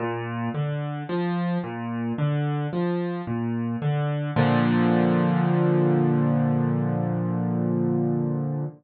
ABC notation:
X:1
M:4/4
L:1/8
Q:1/4=55
K:Bb
V:1 name="Acoustic Grand Piano" clef=bass
B,, D, F, B,, D, F, B,, D, | [B,,D,F,]8 |]